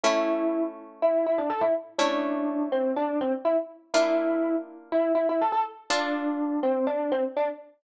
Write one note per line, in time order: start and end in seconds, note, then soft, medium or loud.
0.03 1.95 A3 medium
0.03 1.95 C#4 medium
0.03 0.63 E4 medium
0.03 1.95 E4 medium
1.02 1.25 E4 medium
1.26 1.38 E4 medium
1.38 1.50 D4 medium
1.50 1.61 A4 medium
1.61 1.73 E4 medium
1.98 3.90 A3 medium
1.98 3.90 C#4 medium
1.98 2.66 D4 medium
1.98 3.90 E4 medium
2.72 2.92 C4 medium
2.96 3.19 D4 medium
3.21 3.32 C4 medium
3.45 3.56 E4 medium
3.94 5.85 A#3 medium
3.94 5.85 D4 medium
3.94 4.55 E4 loud
3.94 5.85 F4 medium
4.92 5.12 E4 medium
5.15 5.26 E4 medium
5.29 5.41 E4 medium
5.41 5.52 A4 medium
5.52 5.64 A4 loud
5.90 6.60 D4 medium
5.90 7.81 D4 medium
5.90 7.81 F4 medium
5.90 7.81 A4 medium
6.63 6.85 C4 medium
6.87 7.11 D4 medium
7.12 7.23 C4 medium
7.36 7.48 D4 medium